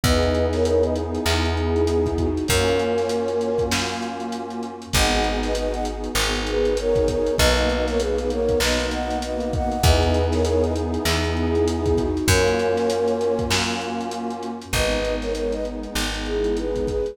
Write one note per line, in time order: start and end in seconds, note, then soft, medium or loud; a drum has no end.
0.04 1.18 E2 medium
0.04 2.26 B3 loud
0.04 2.26 D#4 loud
0.04 2.26 E4 medium
0.04 2.26 G#4 loud
0.04 0.46 B4 medium
0.04 0.46 D#5 medium
0.04 kick loud
0.04 closed hi-hat loud
0.23 closed hi-hat medium
0.35 closed hi-hat medium
0.53 0.65 A#4 medium
0.53 0.65 C#5 medium
0.53 snare medium
0.53 closed hi-hat medium
0.65 0.83 A#4 medium
0.65 0.83 C#5 medium
0.65 closed hi-hat loud
0.83 0.95 B4 medium
0.83 0.95 D#5 medium
0.83 closed hi-hat medium
0.96 closed hi-hat medium
1.15 closed hi-hat medium
1.26 2.40 E2 medium
1.26 clap loud
1.45 closed hi-hat medium
1.55 1.85 E4 medium
1.55 1.85 G#4 medium
1.55 closed hi-hat medium
1.76 closed hi-hat medium
1.87 2.17 E4 medium
1.87 2.17 G#4 medium
1.87 closed hi-hat loud
2.06 kick medium
2.06 closed hi-hat medium
2.18 2.46 D#4 medium
2.18 2.46 F#4 medium
2.18 kick medium
2.18 closed hi-hat medium
2.37 closed hi-hat medium
2.47 3.64 F#2 loud
2.47 4.70 A#3 loud
2.47 4.70 C#4 loud
2.47 4.70 F4 loud
2.47 4.70 F#4 medium
2.47 3.63 A#4 medium
2.47 3.63 C#5 medium
2.47 kick loud
2.47 closed hi-hat loud
2.68 closed hi-hat medium
2.79 closed hi-hat medium
2.98 snare medium
2.98 closed hi-hat medium
3.09 closed hi-hat loud
3.28 closed hi-hat medium
3.41 closed hi-hat medium
3.58 kick medium
3.58 closed hi-hat medium
3.72 4.86 F#2 medium
3.72 snare loud
3.90 closed hi-hat medium
4.02 closed hi-hat medium
4.20 closed hi-hat medium
4.32 closed hi-hat loud
4.50 closed hi-hat medium
4.63 closed hi-hat medium
4.82 closed hi-hat medium
4.93 6.09 G#1 loud
4.93 5.51 B3 loud
4.93 5.51 D#4 loud
4.93 5.51 F#4 loud
4.93 5.51 G#4 loud
4.93 5.38 D#5 medium
4.93 5.38 F#5 loud
4.93 kick loud
4.93 closed hi-hat loud
5.12 closed hi-hat medium
5.24 closed hi-hat medium
5.43 5.54 B4 medium
5.43 5.54 D#5 medium
5.43 snare medium
5.43 closed hi-hat medium
5.55 6.11 B3 medium
5.55 6.11 D#4 medium
5.55 6.11 F#4 medium
5.55 6.11 G#4 medium
5.55 5.72 B4 medium
5.55 5.72 D#5 medium
5.55 closed hi-hat loud
5.73 5.85 D#5 medium
5.73 5.85 F#5 medium
5.73 closed hi-hat medium
5.85 closed hi-hat loud
6.04 closed hi-hat medium
6.15 7.30 G#1 medium
6.15 6.73 B3 medium
6.15 6.73 D#4 medium
6.15 6.73 F#4 medium
6.15 6.73 G#4 medium
6.15 clap loud
6.35 closed hi-hat medium
6.47 6.75 G#4 medium
6.47 6.75 B4 loud
6.47 closed hi-hat loud
6.65 closed hi-hat medium
6.77 7.34 B3 medium
6.77 7.34 D#4 loud
6.77 7.34 F#4 medium
6.77 7.34 G#4 medium
6.77 7.07 A#4 medium
6.77 7.07 C#5 loud
6.77 closed hi-hat loud
6.96 kick medium
6.96 closed hi-hat medium
7.08 7.34 A#4 medium
7.08 7.34 C#5 medium
7.08 kick medium
7.08 closed hi-hat loud
7.27 closed hi-hat medium
7.38 8.54 B1 loud
7.38 7.96 A#3 loud
7.38 7.96 B3 loud
7.38 7.96 D#4 loud
7.38 7.96 F#4 medium
7.38 7.83 B4 medium
7.38 7.83 D#5 loud
7.38 kick loud
7.56 closed hi-hat medium
7.70 snare soft
7.70 closed hi-hat medium
7.88 8.00 A#4 medium
7.88 8.00 C#5 medium
7.88 snare medium
7.88 closed hi-hat medium
7.99 8.57 A#3 loud
7.99 8.57 B3 medium
7.99 8.57 D#4 medium
7.99 8.57 F#4 medium
7.99 8.17 G#4 medium
7.99 8.17 B4 medium
7.99 closed hi-hat loud
8.18 8.29 G#4 medium
8.18 8.29 B4 medium
8.18 closed hi-hat medium
8.30 8.59 A#4 medium
8.30 8.59 C#5 loud
8.30 closed hi-hat medium
8.49 kick medium
8.49 closed hi-hat medium
8.60 9.75 B1 medium
8.60 9.18 A#3 medium
8.60 9.18 B3 loud
8.60 9.18 D#4 medium
8.60 9.18 F#4 medium
8.60 8.86 B4 medium
8.60 8.86 D#5 medium
8.60 snare loud
8.80 closed hi-hat medium
8.91 9.17 D#5 medium
8.91 9.17 F#5 medium
8.91 closed hi-hat loud
9.10 snare soft
9.10 closed hi-hat medium
9.22 9.79 A#3 loud
9.22 9.79 B3 medium
9.22 9.79 D#4 medium
9.22 9.79 F#4 medium
9.22 9.51 B4 medium
9.22 9.51 D#5 medium
9.22 closed hi-hat loud
9.40 closed hi-hat medium
9.53 9.82 D#5 medium
9.53 9.82 F#5 medium
9.53 kick loud
9.53 closed hi-hat medium
9.72 closed hi-hat medium
9.83 10.98 E2 medium
9.83 12.05 B3 loud
9.83 12.05 D#4 loud
9.83 12.05 E4 medium
9.83 12.05 G#4 loud
9.83 10.25 B4 medium
9.83 10.25 D#5 loud
9.83 kick loud
9.83 closed hi-hat loud
10.03 closed hi-hat medium
10.14 closed hi-hat medium
10.32 10.44 A#4 medium
10.32 10.44 C#5 medium
10.32 snare medium
10.32 closed hi-hat medium
10.45 10.62 A#4 medium
10.45 10.62 C#5 loud
10.45 closed hi-hat loud
10.62 10.74 B4 medium
10.62 10.74 D#5 medium
10.62 closed hi-hat medium
10.76 closed hi-hat medium
10.94 closed hi-hat medium
11.05 12.20 E2 medium
11.05 clap loud
11.24 closed hi-hat medium
11.36 11.65 E4 medium
11.36 11.65 G#4 medium
11.36 closed hi-hat medium
11.55 closed hi-hat medium
11.68 11.97 E4 medium
11.68 11.97 G#4 medium
11.68 closed hi-hat loud
11.86 kick medium
11.86 closed hi-hat medium
11.98 12.27 D#4 medium
11.98 12.27 F#4 medium
11.98 kick medium
11.98 closed hi-hat medium
12.17 closed hi-hat medium
12.27 13.42 F#2 loud
12.27 14.49 A#3 loud
12.27 14.49 C#4 loud
12.27 14.49 F4 loud
12.27 14.49 F#4 loud
12.27 13.43 A#4 medium
12.27 13.43 C#5 loud
12.27 kick loud
12.27 closed hi-hat loud
12.47 closed hi-hat medium
12.59 closed hi-hat medium
12.77 snare medium
12.77 closed hi-hat medium
12.90 closed hi-hat loud
13.08 closed hi-hat medium
13.21 closed hi-hat medium
13.39 kick medium
13.39 closed hi-hat medium
13.51 14.65 F#2 medium
13.51 snare loud
13.69 closed hi-hat medium
13.81 closed hi-hat medium
14.01 closed hi-hat medium
14.11 closed hi-hat loud
14.30 closed hi-hat medium
14.43 closed hi-hat medium
14.62 closed hi-hat medium
14.73 15.88 G#1 medium
14.73 16.95 G#3 medium
14.73 16.95 B3 medium
14.73 16.95 D#4 medium
14.73 15.14 B4 medium
14.73 15.14 D#5 loud
14.73 kick loud
14.73 closed hi-hat loud
14.91 closed hi-hat medium
15.04 closed hi-hat medium
15.21 15.32 A#4 medium
15.21 15.32 C#5 medium
15.21 snare medium
15.21 closed hi-hat medium
15.35 15.52 A#4 medium
15.35 15.52 C#5 medium
15.35 closed hi-hat loud
15.52 15.65 B4 medium
15.52 15.65 D#5 medium
15.52 snare soft
15.52 closed hi-hat medium
15.65 closed hi-hat medium
15.83 closed hi-hat medium
15.95 17.10 G#1 medium
15.95 snare loud
16.14 closed hi-hat medium
16.26 16.55 E4 medium
16.26 16.55 G#4 medium
16.26 closed hi-hat medium
16.44 closed hi-hat medium
16.57 16.86 G#4 medium
16.57 16.86 B4 medium
16.57 closed hi-hat medium
16.76 kick medium
16.76 closed hi-hat medium
16.88 17.16 G#4 medium
16.88 17.16 B4 medium
16.88 kick medium
16.88 closed hi-hat medium
17.06 closed hi-hat medium